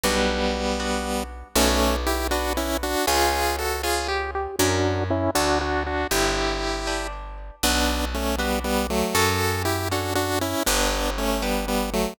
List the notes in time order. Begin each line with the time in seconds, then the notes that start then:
0.03 B1 G3 B3 D4 F#4
0.80 B3 D4 F#4
1.55 B1 A3 B3 C#4 D4 F#4
2.07 E4 G4
2.31 B3 D4 F#4
2.57 C#4 E4
2.83 D4 F#4
3.07 C#2 C#4 F4 G#4
3.58 F#4 A4
3.83 C#4 F4 G#4
4.08 G4
4.35 G4
4.59 F#2 C#4 D4 E4 F#4 A#4
5.10 C#4 E4
5.35 D2 D4 F#4 A4
5.61 D4 F#4
5.86 D4 F#4
6.11 G1 D4 E4 G4 B4
6.87 D4 G4 B4
7.63 B1 B3 D4 F#4 B4
8.14 A3 C#4
8.38 G3 B3 D4 F#4 B4
8.64 G3 B3
8.90 F#3 A3
9.15 F#2 C#4 F#4 A4
9.65 E4 G4
9.91 C#4 D4 F#4 A4
10.15 D4 F#4
10.41 C#4 E4
10.66 G1 B3 D4 G4
11.18 A3 C#4
11.42 G3 B3 D4 G4
11.68 G3 B3
11.93 F#3 A3